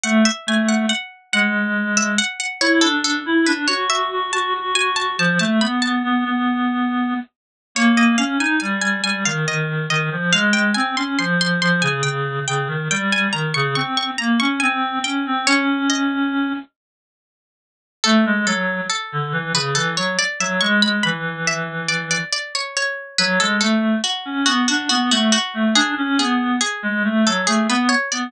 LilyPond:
<<
  \new Staff \with { instrumentName = "Harpsichord" } { \time 3/4 \key a \major \tempo 4 = 70 fis''16 e''16 gis''16 fis''16 fis''8 fis''8 r16 e''16 fis''16 fis''16 | cis''16 a'16 a'8 b'16 cis''16 e''8 a''8 gis''16 a''16 | a''16 a''16 b''16 a''4.~ a''16 r8 | \key aes \major des''16 ees''16 f''16 aes''16 aes''16 aes''16 aes''16 f''16 ees''8 ees''8 |
f''16 g''16 aes''16 c'''16 c'''16 c'''16 c'''16 aes''16 g''8 g''8 | g''16 aes''16 bes''16 des'''16 des'''16 des'''16 bes''16 des'''16 aes''8 g''8 | des''8 ees''4 r4. | \key a \major a'8 a'8 a'8. b'16 a'16 cis''16 d''16 e''16 |
cis'''16 b''16 b''8 e''8 d''16 d''16 d''16 cis''16 cis''8 | b'16 a'16 a'8 fis'8 fis'16 fis'16 fis'16 fis'16 fis'8 | gis'8 gis'8 gis'8. a'16 gis'16 b'16 cis''16 d''16 | }
  \new Staff \with { instrumentName = "Clarinet" } { \time 3/4 \key a \major a16 r16 a8 r8 gis4 r8 | e'16 d'8 e'16 d'16 fis'8 fis'16 fis'16 fis'16 fis'8 | f16 a16 b16 b16 b16 b4~ b16 r8 | \key aes \major bes8 des'16 ees'16 g8 g16 ees16 ees8 ees16 f16 |
aes8 c'16 des'16 f8 f16 des16 des8 des16 ees16 | g8 ees16 des16 c'8 bes16 des'16 c'8 des'16 c'16 | des'4. r4. | \key a \major a16 gis16 fis8 r16 d16 e16 cis16 e16 fis16 r16 fis16 |
gis16 gis16 e4. r4 | fis16 gis16 a8 r16 cis'16 b16 d'16 b16 a16 r16 a16 | d'16 cis'16 b8 r16 gis16 a16 fis16 a16 b16 r16 b16 | }
>>